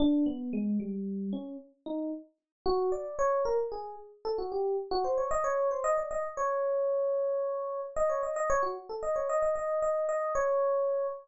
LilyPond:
\new Staff { \time 6/8 \tempo 4. = 75 d'8 b8 aes8 g4 des'8 | r8 ees'8 r4 ges'8 d''8 | des''8 bes'16 r16 aes'8 r8 a'16 ges'16 g'8 | r16 ges'16 c''16 des''16 ees''16 des''8 c''16 ees''16 d''16 ees''16 r16 |
des''2. | ees''16 des''16 ees''16 ees''16 des''16 ges'16 r16 a'16 ees''16 des''16 ees''16 ees''16 | ees''8 ees''8 ees''8 des''4. | }